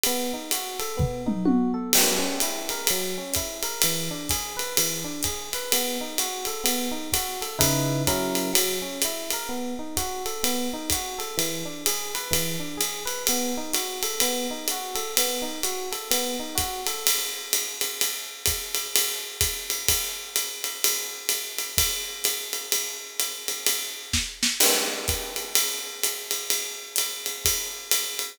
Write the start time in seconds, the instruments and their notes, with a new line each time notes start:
0.03 electric piano 1 B3, ride
0.33 electric piano 1 D#4
0.51 electric piano 1 F#4, hi-hat pedal, ride
0.79 electric piano 1 A4, ride
0.97 electric piano 1 B3, kick, floor tom
1.26 electric piano 1 D#4, mid tom
1.45 electric piano 1 F#4, high tom
1.74 electric piano 1 A4
1.93 electric piano 1 F#3, crash, ride
2.19 electric piano 1 C#4
2.40 electric piano 1 E4, hi-hat pedal, ride
2.69 electric piano 1 A#4, ride
2.87 electric piano 1 F#3, ride
3.18 electric piano 1 C#4
3.34 electric piano 1 E4, kick, hi-hat pedal, ride
3.63 electric piano 1 A#4, ride
3.82 electric piano 1 E3, ride
4.11 electric piano 1 D4
4.29 electric piano 1 G#4, kick, hi-hat pedal, ride
4.57 electric piano 1 B4, ride
4.77 electric piano 1 E3, ride
5.04 electric piano 1 D4
5.23 electric piano 1 G#4, kick, hi-hat pedal, ride
5.53 electric piano 1 B4, ride
5.72 electric piano 1 B3, ride
6.01 electric piano 1 D#4
6.18 electric piano 1 F#4, hi-hat pedal, ride
6.45 electric piano 1 A4, ride
6.64 electric piano 1 B3, ride
6.91 electric piano 1 D#4
7.12 electric piano 1 F#4, kick, hi-hat pedal, ride
7.41 electric piano 1 A4, ride
7.59 electric piano 1 C#3 D#4 E4 B4, kick, ride
8.07 electric piano 1 F#3 C#4 E4 A#4, kick, hi-hat pedal, ride
8.35 ride
8.53 electric piano 1 F#3, ride
8.82 electric piano 1 C#4
9.02 electric piano 1 E4, hi-hat pedal, ride
9.31 electric piano 1 A#4, ride
9.49 electric piano 1 B3
9.79 electric piano 1 D#4
9.97 electric piano 1 F#4, kick, hi-hat pedal, ride
10.26 electric piano 1 A4, ride
10.43 electric piano 1 B3, ride
10.73 electric piano 1 D#4
10.90 electric piano 1 F#4, kick, hi-hat pedal, ride
11.19 electric piano 1 A4, ride
11.37 electric piano 1 E3, ride
11.65 electric piano 1 D4
11.86 electric piano 1 G#4, hi-hat pedal, ride
12.15 electric piano 1 B4, ride
12.31 electric piano 1 E3, kick, ride
12.60 electric piano 1 D4
12.77 electric piano 1 G#4, hi-hat pedal, ride
13.05 electric piano 1 B4, ride
13.27 electric piano 1 B3, ride
13.57 electric piano 1 D#4
13.73 electric piano 1 F#4, hi-hat pedal, ride
14.02 electric piano 1 A4, ride
14.20 electric piano 1 B3, ride
14.51 electric piano 1 D#4
14.68 electric piano 1 F#4, hi-hat pedal, ride
14.95 electric piano 1 A4, ride
15.17 electric piano 1 B3, ride
15.42 electric piano 1 D#4
15.63 electric piano 1 F#4, hi-hat pedal, ride
15.92 electric piano 1 A4, ride
16.11 electric piano 1 B3, ride
16.40 electric piano 1 D#4
16.55 electric piano 1 F#4, kick, hi-hat pedal, ride
16.87 electric piano 1 A4, ride
17.07 ride
17.53 hi-hat pedal, ride
17.81 ride
18.01 ride
18.46 kick, hi-hat pedal, ride
18.75 ride
18.96 ride
19.41 kick, hi-hat pedal, ride
19.70 ride
19.88 kick, ride
20.36 hi-hat pedal, ride
20.64 ride
20.84 ride
21.29 hi-hat pedal, ride
21.58 ride
21.78 kick, ride
22.24 hi-hat pedal, ride
22.53 ride
22.72 ride
23.20 hi-hat pedal, ride
23.48 ride
23.67 ride
24.13 kick, snare
24.43 snare
24.60 crash, ride
25.08 kick, hi-hat pedal, ride
25.36 ride
25.55 ride
26.03 hi-hat pedal, ride
26.31 ride
26.50 ride
26.96 hi-hat pedal, ride
27.26 ride
27.45 kick, ride
27.91 hi-hat pedal, ride
28.19 ride